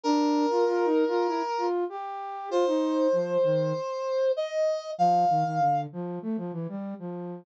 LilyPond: <<
  \new Staff \with { instrumentName = "Brass Section" } { \time 4/4 \key bes \major \tempo 4 = 97 bes'2. r4 | c''2. ees''4 | f''4. r2 r8 | }
  \new Staff \with { instrumentName = "Flute" } { \time 4/4 \key bes \major d'8. f'16 \tuplet 3/2 { f'8 ees'8 f'8 } e'16 r16 f'8 g'4 | f'16 ees'8. f8 ees8 r2 | f8 ees16 ees16 d8 f8 a16 f16 e16 g8 f8. | }
>>